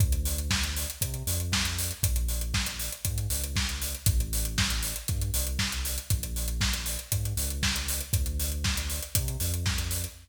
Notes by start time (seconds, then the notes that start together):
0.00 D2, kick, closed hi-hat
0.12 closed hi-hat
0.25 open hi-hat
0.38 closed hi-hat
0.51 kick, snare
0.63 closed hi-hat
0.76 open hi-hat
0.90 closed hi-hat
1.01 C3, kick, closed hi-hat
1.14 closed hi-hat
1.27 F2, open hi-hat
1.40 closed hi-hat
1.52 kick, snare
1.65 closed hi-hat
1.78 open hi-hat
1.91 closed hi-hat
2.03 A#1, kick, closed hi-hat
2.16 closed hi-hat
2.28 open hi-hat
2.41 closed hi-hat
2.54 kick, snare
2.66 closed hi-hat
2.79 open hi-hat
2.92 closed hi-hat
3.05 G#2, kick, closed hi-hat
3.18 closed hi-hat
3.30 C#2, open hi-hat
3.44 closed hi-hat
3.56 kick, snare
3.69 closed hi-hat
3.82 open hi-hat
3.94 closed hi-hat
4.06 A1, kick, closed hi-hat
4.20 closed hi-hat
4.33 open hi-hat
4.45 closed hi-hat
4.58 kick, snare
4.70 closed hi-hat
4.83 open hi-hat
4.96 closed hi-hat
5.08 G2, kick, closed hi-hat
5.21 closed hi-hat
5.34 C2, open hi-hat
5.47 closed hi-hat
5.59 kick, snare
5.72 closed hi-hat
5.85 open hi-hat
5.98 closed hi-hat
6.10 A#1, kick, closed hi-hat
6.23 closed hi-hat
6.36 open hi-hat
6.48 closed hi-hat
6.61 kick, snare
6.74 closed hi-hat
6.86 open hi-hat
6.99 closed hi-hat
7.12 G#2, kick, closed hi-hat
7.25 closed hi-hat
7.37 C#2, open hi-hat
7.50 closed hi-hat
7.63 kick, snare
7.76 closed hi-hat
7.88 open hi-hat
8.01 closed hi-hat
8.13 D2, kick, closed hi-hat
8.26 closed hi-hat
8.40 open hi-hat
8.52 closed hi-hat
8.64 kick, snare
8.77 closed hi-hat
8.90 open hi-hat
9.02 closed hi-hat
9.15 C3, kick, closed hi-hat
9.28 closed hi-hat
9.40 F2, open hi-hat
9.54 closed hi-hat
9.66 kick, snare
9.78 closed hi-hat
9.91 open hi-hat
10.04 closed hi-hat